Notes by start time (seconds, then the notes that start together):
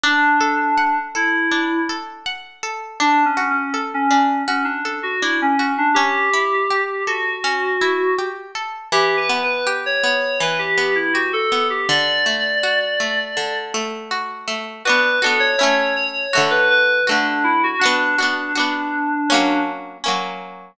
0.03 D4
0.41 A4
0.77 F#5
1.15 E4 A4
1.51 D4
1.89 A4
2.26 F#5
2.63 A4
3.00 D4
3.25 C#4
3.37 F#4
3.50 C#4
3.74 A4
3.94 C#4
4.10 C#4 D4
4.47 C#4 F#4
4.64 D4
4.85 A4
5.03 F#4
5.22 D4 E4
5.42 C#4
5.59 F#4
5.78 D4
5.94 C#4 G4
6.33 E4
6.70 G4
7.07 F#4 A4
7.44 C#4
7.81 E4
8.18 G4
8.55 A4
8.92 E3 G4
9.17 B4
9.29 B3
9.43 B4
9.67 G4
9.86 C#5
10.03 B3 C#5
10.40 E3 B4
10.58 G4
10.77 B3
10.95 E4
11.13 F#4 G4
11.33 A4
11.52 B3
11.70 G4
11.89 D3 D5
12.26 A3
12.63 F#4
13.00 A3
13.37 D3
13.74 A3
14.11 F#4
14.48 A3
14.85 D4 F#4 B4
14.89 B3
15.22 D4 F#4 A4
15.26 B3
15.40 C#5
15.57 C#4 E4 C#5
15.63 A3
15.96 C#5
16.33 A3 F#4
16.37 D3
16.50 B4
16.70 B4
17.07 A3 D4 F#4
17.11 D3
17.44 E4
17.63 F#4
17.79 D4 F#4
17.83 B3 D4
18.18 D4 F#4
18.22 B3
18.55 D4 F#4
18.59 B3
19.30 A#3 C#4
19.34 F#3
20.04 A#3 C#4
20.08 F#3